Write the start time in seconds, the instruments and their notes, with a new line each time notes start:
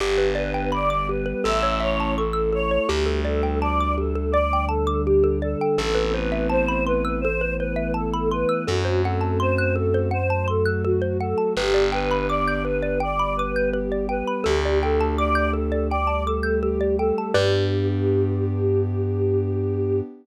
0.00 electric bass (finger) G1, pad 2 (warm) B3 D4 G4, xylophone G4, choir aahs G4
0.18 xylophone B4
0.35 choir aahs B4, xylophone D5
0.54 xylophone G5
0.72 pad 2 (warm) G3 B3 G4, choir aahs D5, xylophone B5
0.90 xylophone D6
1.09 xylophone G4, choir aahs B4
1.26 xylophone B4
1.44 electric bass (finger) A1, pad 2 (warm) A3 C#4 E4, xylophone A4, choir aahs E5
1.63 xylophone C#5
1.80 choir aahs C#5, xylophone E5
2.00 xylophone A5
2.16 pad 2 (warm) A3 E4 A4, choir aahs A4, xylophone C#6
2.33 xylophone E6
2.53 xylophone A4, choir aahs C#5
2.71 xylophone C#5
2.88 electric bass (finger) D2, pad 2 (warm) G3 A3 D4, choir aahs G4, xylophone G4
3.06 xylophone A4
3.25 choir aahs A4, xylophone D5
3.43 xylophone G5
3.61 choir aahs D5, xylophone A5
3.80 xylophone D6
3.98 xylophone G4, choir aahs A4
4.15 xylophone A4
4.32 pad 2 (warm) D3 G3 D4, choir aahs D5, xylophone D5
4.53 xylophone G5
4.68 choir aahs A4, xylophone A5
4.87 xylophone D6
5.06 choir aahs G4, xylophone G4
5.24 xylophone A4
5.42 choir aahs A4, xylophone D5
5.61 xylophone G5
5.78 electric bass (finger) A1, pad 2 (warm) A3 B3 C4 E4, xylophone A4, choir aahs A4
5.95 xylophone B4
6.14 choir aahs B4, xylophone C5
6.32 xylophone E5
6.50 choir aahs C5, xylophone A5
6.68 xylophone B5
6.86 choir aahs B4, xylophone C6
7.05 xylophone E6
7.21 pad 2 (warm) E3 A3 B3 E4, xylophone A4, choir aahs C5
7.41 xylophone B4
7.58 choir aahs B4, xylophone C5
7.76 xylophone E5
7.94 choir aahs A4, xylophone A5
8.14 xylophone B5
8.31 choir aahs B4, xylophone C6
8.49 xylophone E6
8.67 electric bass (finger) F#2, pad 2 (warm) A3 C4 F#4, choir aahs F#4, xylophone A4
8.85 xylophone C5
9.04 choir aahs A4, xylophone F#5
9.21 xylophone A5
9.40 choir aahs C5, xylophone C6
9.58 xylophone F#6
9.75 choir aahs A4, xylophone A4
9.94 xylophone C5
10.11 pad 2 (warm) F#3 A3 F#4, choir aahs C5, xylophone F#5
10.30 xylophone A5
10.48 choir aahs A4, xylophone C6
10.66 xylophone F#6
10.84 choir aahs F#4, xylophone A4
11.02 xylophone C5
11.20 choir aahs A4, xylophone F#5
11.38 xylophone A5
11.55 electric bass (finger) G1, pad 2 (warm) B3 D4 G4, choir aahs G4, xylophone B4
11.74 xylophone D5
11.92 choir aahs B4, xylophone G5
12.11 xylophone B5
12.29 choir aahs D5, xylophone D6
12.48 xylophone G6
12.65 xylophone B4, choir aahs B4
12.83 xylophone D5
13.00 pad 2 (warm) G3 B3 G4, choir aahs D5, xylophone G5
13.19 xylophone B5
13.36 choir aahs B4, xylophone D6
13.56 xylophone G6
13.73 choir aahs G4, xylophone B4
13.92 xylophone D5
14.09 choir aahs B4, xylophone G5
14.27 xylophone B5
14.44 electric bass (finger) D2, pad 2 (warm) A3 D4 G4, choir aahs G4, xylophone A4
14.65 xylophone D5
14.82 choir aahs A4, xylophone G5
15.01 xylophone A5
15.17 choir aahs D5, xylophone D6
15.35 xylophone G6
15.53 xylophone A4, choir aahs A4
15.72 xylophone D5
15.90 pad 2 (warm) G3 A3 G4, choir aahs D5, xylophone G5
16.07 xylophone A5
16.26 choir aahs A4, xylophone D6
16.43 xylophone G6
16.63 choir aahs G4, xylophone A4
16.81 xylophone D5
16.98 choir aahs A4, xylophone G5
17.18 xylophone A5
17.33 electric bass (finger) G2, pad 2 (warm) B3 D4 G4, choir aahs G4, xylophone G4 B4 D5